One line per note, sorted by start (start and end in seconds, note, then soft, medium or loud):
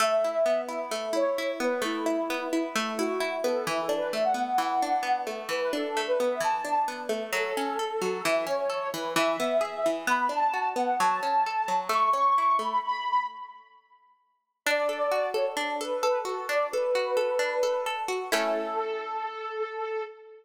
0.00 0.91 A3 medium
0.00 0.61 E5 medium
0.24 0.68 E4 medium
0.46 1.60 B3 medium
0.69 1.12 E4 medium
0.69 0.80 E5 medium
0.91 1.81 A3 medium
1.13 1.38 E4 medium
1.13 1.51 C#5 medium
1.38 2.06 E4 medium
1.60 2.29 B3 medium
1.60 1.80 B4 medium
1.82 2.75 A3 medium
1.82 2.47 E4 medium
2.06 2.52 E4 medium
2.30 3.44 B3 medium
2.52 2.63 E4 medium
2.52 2.98 E4 medium
2.75 3.62 A3 medium
2.98 3.20 E4 medium
2.98 3.35 F#4 medium
3.20 3.64 E4 medium
3.44 3.66 B3 medium
3.44 3.65 A4 medium
3.67 4.58 E3 medium
3.67 3.81 E4 medium
3.81 3.96 A4 medium
3.89 4.82 D4 medium
3.97 4.11 B4 medium
4.12 5.26 A3 medium
4.12 4.23 E5 medium
4.24 4.42 F#5 medium
4.34 5.02 B3 medium
4.47 4.67 F#5 medium
4.58 5.48 E3 medium
4.69 5.20 F#5 medium
4.82 5.72 D4 medium
5.03 6.19 B3 medium
5.27 5.96 A3 medium
5.49 6.40 E3 medium
5.49 5.60 B4 medium
5.61 5.72 B4 medium
5.73 6.64 D4 medium
5.73 6.02 A4 medium
5.97 7.09 A3 medium
6.07 6.18 B4 medium
6.19 6.87 B3 medium
6.19 6.29 B4 medium
6.30 6.41 E5 medium
6.40 7.27 E3 medium
6.40 6.85 A5 medium
6.65 7.30 D4 medium
6.88 7.31 B3 medium
7.09 7.31 A3 medium
7.33 7.53 F#3 medium
7.33 8.23 A4 medium
7.57 7.78 C#4 medium
7.79 8.00 A4 medium
8.02 8.22 F#3 medium
8.24 8.46 E3 medium
8.24 8.45 E5 medium
8.47 8.67 C#4 medium
8.47 8.88 C#5 medium
8.70 8.90 A4 medium
8.93 9.14 E3 medium
8.93 9.13 B4 medium
9.16 9.37 E3 loud
9.16 9.90 E5 medium
9.40 9.60 B3 medium
9.61 9.81 G#4 medium
9.86 10.06 E3 medium
10.07 10.28 B3 medium
10.07 10.27 B5 medium
10.29 10.50 D4 medium
10.29 10.67 A5 medium
10.54 10.74 F#4 medium
10.76 10.97 B3 medium
10.76 10.97 F#5 medium
10.99 11.21 F#3 medium
10.99 11.76 A5 medium
11.23 11.43 C#4 medium
11.46 11.67 A4 medium
11.68 11.89 F#3 medium
11.89 12.10 A3 medium
11.89 12.11 C#6 medium
12.13 12.34 C#4 medium
12.13 12.57 C#6 medium
12.38 12.59 E4 medium
12.59 12.80 A3 medium
12.59 12.79 B5 medium
12.83 13.25 B5 medium
14.66 15.56 D4 loud
14.66 15.29 D5 medium
14.89 15.34 A4 medium
15.11 16.24 F#4 medium
15.34 15.80 A4 medium
15.34 15.45 C#5 medium
15.57 16.48 D4 medium
15.80 16.02 A4 medium
15.80 16.19 B4 medium
16.03 16.73 A4 medium
16.25 16.95 F#4 medium
16.25 16.46 A4 medium
16.49 17.39 D4 medium
16.49 16.67 D5 medium
16.72 17.16 A4 medium
16.72 17.84 B4 medium
16.95 18.08 F#4 medium
17.17 17.62 A4 medium
17.39 18.26 D4 medium
17.63 17.86 A4 medium
17.86 18.30 A4 medium
18.08 18.30 F#4 medium
18.32 20.02 A3 medium
18.32 20.02 C#4 loud
18.32 20.02 E4 medium
18.32 20.02 A4 loud